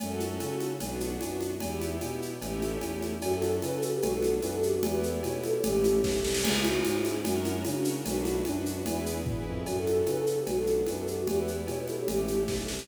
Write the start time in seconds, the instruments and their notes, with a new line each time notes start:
0.00 violin F#2, string ensemble 1 C#4 F#4 A4, cowbell, low conga, shaker
0.20 high conga, shaker
0.40 violin C#3, cowbell, high conga, shaker
0.60 high conga, shaker
0.80 violin B1, string ensemble 1 B3 D4 F#4, cowbell, low conga, shaker
1.00 high conga, shaker
1.21 violin F#2, cowbell, high conga, shaker
1.41 high conga, shaker
1.60 violin E2, string ensemble 1 B3 E4 G4, cowbell, low conga, shaker
1.81 high conga, shaker
2.01 violin B2, cowbell, high conga, shaker
2.22 shaker
2.41 violin A1, string ensemble 1 A3 C#4 E4 G4, cowbell, low conga, shaker
2.62 high conga, shaker
2.81 violin E2, cowbell, high conga, shaker
3.02 high conga, shaker
3.22 violin F#2, string ensemble 1 C#4 F#4 A4, flute F#4, cowbell, shaker
3.33 flute A4
3.42 high conga, shaker
3.62 violin C#3, flute B4, cowbell, high conga, shaker
3.73 flute A4
3.82 flute A4, shaker
3.93 flute G4
4.02 violin B1, string ensemble 1 B3 D4 F#4, flute F#4, cowbell, low conga, shaker
4.12 flute A4
4.22 high conga, shaker
4.42 violin F#2, flute B4, cowbell, high conga, shaker
4.53 flute A4
4.63 flute G4, shaker
4.73 flute F#4
4.83 violin E2, string ensemble 1 B3 E4 G4, flute G4, cowbell, low conga, shaker
4.92 flute B4
5.03 shaker
5.23 violin B2, flute C#5, cowbell, high conga, shaker
5.34 flute B4
5.44 flute A4, high conga, shaker
5.54 flute G4
5.63 violin A1, string ensemble 1 A3 C#4 E4 G4, flute G4, cowbell, low conga, shaker
5.84 high conga, shaker
6.04 violin B1, kick, snare
6.24 violin C2, snare
6.34 snare
6.44 violin C#2, string ensemble 1 C#4 E4 G#4, flute G#4, crash, cowbell, low conga, shaker
6.55 flute E4
6.64 flute F#4, high conga, shaker
6.84 violin G#2, string ensemble 1 C#4 E4 G#4, flute F#4, cowbell, high conga, shaker
6.93 flute E4
7.05 high conga, shaker
7.24 violin F#2, string ensemble 1 C#4 F#4 A#4, flute F#4, cowbell, low conga, shaker
7.34 flute D4
7.44 flute E4, high conga, shaker
7.64 violin C#3, string ensemble 1 C#4 F#4 A#4, flute D4, cowbell, high conga, shaker
7.76 flute D4
7.85 shaker
8.05 violin B1, string ensemble 1 D4 F#4 B4, flute F#4, cowbell, low conga, shaker
8.15 flute D4
8.25 flute E4, high conga, shaker
8.45 violin F#2, flute D4, string ensemble 1 D4 F#4 B4, cowbell, high conga, shaker
8.55 flute D4
8.66 shaker
8.86 violin E2, string ensemble 1 E4 G#4 B4, flute E4, cowbell, low conga, shaker
9.06 shaker
9.26 violin E2, string ensemble 1 E4 G#4 B4, kick, floor tom
9.46 violin F2
9.66 violin F#2, string ensemble 1 C#4 F#4 A4, flute F#4, cowbell, shaker
9.76 flute A4
9.87 high conga, shaker
10.06 violin C#3, flute B4, cowbell, high conga, shaker
10.18 flute A4
10.27 flute A4, shaker
10.38 flute G4
10.46 violin B1, string ensemble 1 B3 D4 F#4, flute F#4, cowbell, low conga, shaker
10.57 flute A4
10.67 high conga, shaker
10.86 violin F#2, flute B4, cowbell, high conga, shaker
10.97 flute A4
11.07 flute G4, shaker
11.18 flute F#4
11.27 violin E2, string ensemble 1 B3 E4 G4, flute G4, cowbell, low conga, shaker
11.37 flute B4
11.47 shaker
11.67 violin B2, flute C#5, cowbell, high conga, shaker
11.78 flute B4
11.87 flute A4, high conga, shaker
11.98 flute G4
12.08 violin A1, string ensemble 1 A3 C#4 E4 G4, flute G4, cowbell, low conga, shaker
12.28 high conga, shaker
12.48 violin B1, kick, snare
12.68 violin C2, snare
12.79 snare